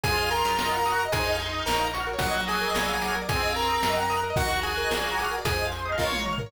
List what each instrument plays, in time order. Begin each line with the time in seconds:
0.03 electric bass (finger) F2, choir aahs F4, lead 1 (square) G#4 G#5, electric piano 1 G#4, overdriven guitar G#4, kick, closed hi-hat
0.11 electric piano 1 C5, overdriven guitar C5
0.18 electric piano 1 D#5, overdriven guitar D#5
0.24 overdriven guitar F5, electric piano 1 F5
0.31 lead 1 (square) A#4 A#5, electric piano 1 G#5, overdriven guitar G#5, closed hi-hat
0.38 electric piano 1 C6, overdriven guitar C6
0.45 electric bass (finger) F#2, electric piano 1 D#6, overdriven guitar D#6
0.52 electric piano 1 F6, overdriven guitar F6
0.58 electric piano 1 A#4, overdriven guitar A#4, snare
0.65 electric piano 1 D#5, overdriven guitar D#5
0.72 electric piano 1 F#5, overdriven guitar F#5
0.78 overdriven guitar A#5, electric piano 1 A#5
0.85 choir aahs F#4, overdriven guitar D#6, electric piano 1 D#6, closed hi-hat
0.92 overdriven guitar F#6, electric piano 1 F#6
0.99 electric piano 1 A#4, overdriven guitar A#4
1.05 overdriven guitar D#5, electric piano 1 D#5
1.12 electric bass (finger) F2, choir aahs D#4, lead 1 (square) G#4 G#5, overdriven guitar G#4, electric piano 1 G#4, kick, closed hi-hat
1.19 overdriven guitar C5, electric piano 1 C5
1.26 overdriven guitar D#5, electric piano 1 D#5
1.33 overdriven guitar F5, electric piano 1 F5
1.39 overdriven guitar G#5, electric piano 1 G#5, closed hi-hat
1.46 overdriven guitar C6, electric piano 1 C6
1.53 overdriven guitar D#6, electric piano 1 D#6
1.60 overdriven guitar F6, electric piano 1 F6
1.66 electric bass (finger) A#1, lead 1 (square) A#4 A#5, electric piano 1 A#4, overdriven guitar A#4, snare
1.73 electric piano 1 C#5, overdriven guitar C#5
1.80 overdriven guitar F5, electric piano 1 F5
1.87 electric piano 1 A#5, overdriven guitar A#5
1.94 choir aahs F#4, electric piano 1 C#6, overdriven guitar C#6, closed hi-hat
2.00 electric piano 1 F6, overdriven guitar F6
2.07 overdriven guitar A#4, electric piano 1 A#4
2.13 overdriven guitar C#5, electric piano 1 C#5
2.19 electric bass (finger) A#1, choir aahs F#3, lead 1 (square) F#4 F#5, electric piano 1 A#4, overdriven guitar A#4, kick, closed hi-hat
2.27 electric piano 1 D#5, overdriven guitar D#5
2.34 electric piano 1 F#5, overdriven guitar F#5
2.41 electric piano 1 A#5, overdriven guitar A#5
2.48 lead 1 (square) G#4 G#5, overdriven guitar D#6, electric piano 1 D#6, closed hi-hat
2.54 overdriven guitar F#6, electric piano 1 F#6
2.61 overdriven guitar A#4, electric piano 1 A#4
2.68 overdriven guitar D#5, electric piano 1 D#5
2.74 electric bass (finger) A#1, overdriven guitar A#4, electric piano 1 A#4, snare
2.81 overdriven guitar D5, electric piano 1 D5
2.88 electric piano 1 F5, overdriven guitar F5
2.95 overdriven guitar A#5, electric piano 1 A#5
3.01 choir aahs F#3, electric piano 1 D6, overdriven guitar D6, closed hi-hat
3.08 overdriven guitar F6, electric piano 1 F6
3.15 electric piano 1 A#4, overdriven guitar A#4
3.22 electric piano 1 D5, overdriven guitar D5
3.29 electric bass (finger) F2, choir aahs C4, overdriven guitar G#4, electric piano 1 G#4, lead 1 (square) G#4 G#5, kick, closed hi-hat
3.35 overdriven guitar C5, electric piano 1 C5
3.42 electric piano 1 D#5, overdriven guitar D#5
3.49 overdriven guitar F5, electric piano 1 F5
3.56 lead 1 (square) A#4 A#5, electric piano 1 G#5, overdriven guitar G#5, closed hi-hat
3.63 overdriven guitar C6, electric piano 1 C6
3.69 electric piano 1 A#4, overdriven guitar D#6
3.77 overdriven guitar F6
3.83 electric bass (finger) F#2, overdriven guitar A#4, snare
3.89 electric piano 1 D#5, overdriven guitar D#5
3.96 overdriven guitar F#5, electric piano 1 F#5
4.03 overdriven guitar A#5, electric piano 1 A#5
4.10 overdriven guitar D#6, electric piano 1 D#6, closed hi-hat
4.17 electric piano 1 F#6, overdriven guitar F#6
4.23 overdriven guitar A#4, electric piano 1 A#4
4.30 overdriven guitar D#5, electric piano 1 D#5
4.36 electric bass (finger) D#2, lead 1 (square) F#4 F#5, choir aahs F#4, overdriven guitar A#4, electric piano 1 A#4, kick, closed hi-hat
4.43 overdriven guitar D#5, electric piano 1 D#5
4.50 electric piano 1 F#5, overdriven guitar F#5
4.57 electric piano 1 A#5, overdriven guitar A#5
4.63 lead 1 (square) G#4 G#5, overdriven guitar D#6, electric piano 1 D#6, closed hi-hat
4.71 electric piano 1 F#6, overdriven guitar F#6
4.77 electric piano 1 A#4, overdriven guitar A#4
4.84 overdriven guitar D#5
4.91 electric bass (finger) A#1, overdriven guitar A#4, snare
4.97 electric piano 1 D5, overdriven guitar D5
5.04 electric piano 1 F5, overdriven guitar F5
5.11 electric piano 1 A#5, overdriven guitar A#5
5.18 choir aahs F#4, electric piano 1 D6, overdriven guitar D6, closed hi-hat
5.25 overdriven guitar F6, electric piano 1 F6
5.31 overdriven guitar A#4, electric piano 1 A#4
5.38 overdriven guitar D5, electric piano 1 D5
5.44 electric bass (finger) F2, electric piano 1 G#4, overdriven guitar G#4, lead 1 (square) G#4 G#5, choir aahs C5, kick, closed hi-hat
5.52 overdriven guitar C5, electric piano 1 C5
5.58 overdriven guitar D#5, electric piano 1 D#5
5.65 overdriven guitar F5, electric piano 1 F5
5.72 overdriven guitar G#5, electric piano 1 G#5, closed hi-hat
5.79 electric piano 1 C6, overdriven guitar C6
5.86 choir aahs D#5, electric piano 1 D#6, overdriven guitar D#6
5.92 overdriven guitar F6, electric piano 1 F6
5.98 electric bass (finger) A#1, lead 1 (square) F4 F5, electric piano 1 A#4, overdriven guitar A#4, choir aahs C#5, kick, snare
6.06 overdriven guitar C#5, electric piano 1 C#5
6.12 overdriven guitar F5, electric piano 1 F5, high tom
6.19 electric piano 1 A#5, overdriven guitar A#5
6.25 electric piano 1 C#6, overdriven guitar C#6, mid tom
6.33 overdriven guitar F6, electric piano 1 F6
6.38 overdriven guitar A#4, electric piano 1 A#4, floor tom
6.46 overdriven guitar C#5, electric piano 1 C#5